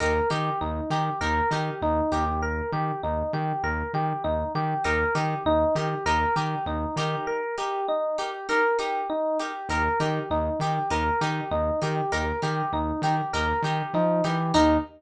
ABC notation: X:1
M:4/4
L:1/8
Q:"Swing 16ths" 1/4=99
K:Ebmix
V:1 name="Electric Piano 1"
B G E G B G E G | B G E G B G E G | B G E G B G E G | B G E G B G E G |
B G E G B G E G | B G E G B G E G | E2 z6 |]
V:2 name="Acoustic Guitar (steel)"
[EGB] [EGB]2 [EGB] [EGB] [EGB]2 [EGB] | z8 | [EGB] [EGB]2 [EGB] [EGB] [EGB]2 [EGB]- | [EGB] [EGB]2 [EGB] [EGB] [EGB]2 [EGB] |
[EGB] [EGB]2 [EGB] [EGB] [EGB]2 [EGB] | [EGB] [EGB]2 [EGB] [EGB] [EGB]2 [EGB] | [EGB]2 z6 |]
V:3 name="Synth Bass 1" clef=bass
E,, E, E,, E, E,, E, E,, E,,- | E,, E, E,, E, E,, E, E,, E, | E,, E, E,, E, E,, E, E,, E, | z8 |
E,, E, E,, E, E,, E, E,, E, | E,, E, E,, E, E,, E, F, =E, | E,,2 z6 |]